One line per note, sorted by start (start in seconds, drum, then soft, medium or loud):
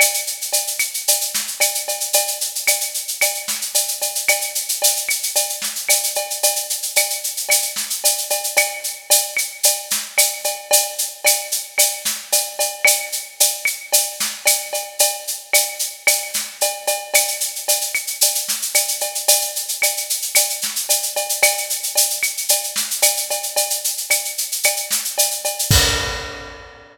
0.00 cowbell medium
0.00 claves loud
0.00 shaker loud
0.14 shaker medium
0.27 shaker medium
0.41 shaker medium
0.53 cowbell medium
0.53 shaker medium
0.67 shaker medium
0.79 claves medium
0.79 shaker medium
0.94 shaker medium
1.08 cowbell medium
1.08 shaker loud
1.21 shaker medium
1.34 snare medium
1.34 shaker medium
1.47 shaker medium
1.60 cowbell medium
1.60 claves medium
1.60 shaker medium
1.74 shaker medium
1.88 cowbell medium
1.88 shaker medium
2.00 shaker medium
2.13 cowbell medium
2.13 shaker loud
2.27 shaker medium
2.41 shaker medium
2.55 shaker medium
2.67 cowbell medium
2.67 claves medium
2.67 shaker loud
2.80 shaker medium
2.94 shaker medium
3.08 shaker medium
3.21 cowbell medium
3.21 claves medium
3.21 shaker medium
3.34 shaker medium
3.48 snare medium
3.48 shaker medium
3.61 shaker medium
3.74 cowbell medium
3.74 shaker loud
3.88 shaker medium
4.02 cowbell medium
4.02 shaker medium
4.15 shaker medium
4.28 cowbell medium
4.28 claves loud
4.28 shaker medium
4.41 shaker medium
4.55 shaker medium
4.69 shaker medium
4.82 cowbell medium
4.82 shaker loud
4.96 shaker medium
5.09 claves medium
5.09 shaker medium
5.23 shaker medium
5.35 cowbell medium
5.35 shaker medium
5.49 shaker medium
5.62 snare medium
5.62 shaker medium
5.75 shaker medium
5.89 cowbell medium
5.89 claves medium
5.89 shaker loud
6.03 shaker medium
6.15 cowbell medium
6.15 shaker medium
6.30 shaker medium
6.43 cowbell medium
6.43 shaker loud
6.56 shaker medium
6.70 shaker medium
6.82 shaker medium
6.96 cowbell medium
6.96 claves medium
6.96 shaker loud
7.10 shaker medium
7.24 shaker medium
7.37 shaker medium
7.49 cowbell medium
7.49 claves medium
7.49 shaker loud
7.62 shaker medium
7.76 snare medium
7.76 shaker medium
7.90 shaker medium
8.04 cowbell medium
8.04 shaker loud
8.18 shaker medium
8.30 cowbell medium
8.30 shaker medium
8.44 shaker medium
8.57 cowbell medium
8.57 claves loud
8.57 shaker loud
8.84 shaker medium
9.10 cowbell medium
9.10 shaker loud
9.37 claves medium
9.37 shaker medium
9.63 cowbell medium
9.63 shaker loud
9.90 snare medium
9.90 shaker medium
10.18 cowbell medium
10.18 claves medium
10.18 shaker loud
10.44 cowbell medium
10.44 shaker medium
10.71 cowbell loud
10.71 shaker loud
10.98 shaker medium
11.25 cowbell medium
11.25 claves medium
11.25 shaker loud
11.52 shaker medium
11.78 cowbell medium
11.78 claves medium
11.78 shaker loud
12.05 snare medium
12.05 shaker medium
12.32 cowbell medium
12.32 shaker loud
12.59 cowbell medium
12.59 shaker medium
12.85 cowbell medium
12.85 claves loud
12.85 shaker loud
13.12 shaker medium
13.40 cowbell medium
13.40 shaker loud
13.65 claves medium
13.65 shaker medium
13.93 cowbell medium
13.93 shaker loud
14.20 snare medium
14.20 shaker medium
14.46 cowbell medium
14.46 claves medium
14.46 shaker loud
14.73 cowbell medium
14.73 shaker medium
14.99 cowbell medium
14.99 shaker loud
15.27 shaker medium
15.53 cowbell medium
15.53 claves medium
15.53 shaker loud
15.79 shaker medium
16.07 cowbell medium
16.07 claves loud
16.07 shaker loud
16.34 snare medium
16.34 shaker medium
16.61 cowbell medium
16.61 shaker medium
16.87 cowbell medium
16.87 shaker medium
17.14 cowbell medium
17.14 claves loud
17.14 shaker loud
17.28 shaker medium
17.40 shaker medium
17.55 shaker medium
17.68 cowbell medium
17.68 shaker loud
17.81 shaker medium
17.94 claves medium
17.94 shaker medium
18.07 shaker medium
18.21 cowbell medium
18.21 shaker loud
18.35 shaker medium
18.48 snare medium
18.48 shaker medium
18.62 shaker medium
18.75 cowbell medium
18.75 claves medium
18.75 shaker loud
18.88 shaker medium
19.01 cowbell medium
19.01 shaker medium
19.15 shaker medium
19.28 cowbell loud
19.28 shaker loud
19.41 shaker medium
19.56 shaker medium
19.68 shaker medium
19.82 cowbell medium
19.82 claves medium
19.82 shaker medium
19.97 shaker medium
20.10 shaker medium
20.22 shaker medium
20.35 cowbell medium
20.35 claves medium
20.35 shaker loud
20.50 shaker medium
20.61 snare medium
20.61 shaker medium
20.76 shaker medium
20.89 cowbell medium
20.89 shaker loud
21.03 shaker medium
21.16 cowbell medium
21.16 shaker medium
21.29 shaker medium
21.43 cowbell loud
21.43 claves loud
21.43 shaker loud
21.57 shaker medium
21.70 shaker medium
21.83 shaker medium
21.96 cowbell medium
21.96 shaker loud
22.10 shaker medium
22.23 claves medium
22.23 shaker medium
22.37 shaker medium
22.49 cowbell medium
22.49 shaker loud
22.64 shaker medium
22.76 snare medium
22.76 shaker medium
22.91 shaker medium
23.02 cowbell medium
23.02 claves medium
23.02 shaker loud
23.17 shaker medium
23.30 cowbell medium
23.30 shaker medium
23.43 shaker medium
23.56 cowbell medium
23.56 shaker medium
23.70 shaker medium
23.84 shaker medium
23.97 shaker medium
24.10 cowbell medium
24.10 claves medium
24.10 shaker medium
24.25 shaker medium
24.38 shaker medium
24.52 shaker medium
24.63 cowbell medium
24.63 claves medium
24.63 shaker medium
24.76 shaker medium
24.91 snare medium
24.91 shaker medium
25.04 shaker medium
25.18 cowbell medium
25.18 shaker loud
25.31 shaker medium
25.45 cowbell medium
25.45 shaker medium
25.59 shaker medium
25.71 kick loud
25.71 crash loud